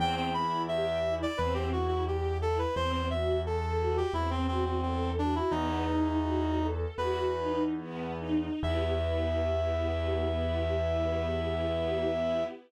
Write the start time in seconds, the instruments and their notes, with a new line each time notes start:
0.00 acoustic grand piano E2, string ensemble 1 C4, clarinet G5
0.17 clarinet G5
0.33 string ensemble 1 E4, clarinet B5
0.68 string ensemble 1 G4, clarinet E5
1.04 string ensemble 1 E4
1.22 clarinet D5
1.37 acoustic grand piano E2, string ensemble 1 C4, clarinet B4
1.54 clarinet G4
1.72 string ensemble 1 E4, clarinet F#4
1.88 clarinet F#4
2.07 clarinet G4, string ensemble 1 G4
2.41 string ensemble 1 E4, clarinet A4
2.58 clarinet B4
2.76 acoustic grand piano E2, string ensemble 1 C4, clarinet C5
2.92 clarinet C5
3.10 string ensemble 1 F#4, clarinet E5
3.45 string ensemble 1 A4, clarinet A4
3.79 string ensemble 1 F#4
3.97 clarinet G4
4.14 acoustic grand piano E2, string ensemble 1 C4, clarinet E4
4.30 clarinet C4
4.48 clarinet C4, string ensemble 1 F#4
4.66 clarinet C4
4.82 clarinet C4, string ensemble 1 A4
5.18 clarinet D4, string ensemble 1 F#4
5.35 clarinet E4
5.51 acoustic grand piano E2, string ensemble 1 B3, clarinet D#4
5.87 string ensemble 1 D#4
6.22 string ensemble 1 F#4
6.59 string ensemble 1 A4
6.98 acoustic grand piano E2, string ensemble 1 F#4, clarinet B4
7.37 string ensemble 1 D#4
7.78 string ensemble 1 B3
8.20 string ensemble 1 D#4
8.63 acoustic grand piano E2, string ensemble 1 B3 E4 G4, clarinet E5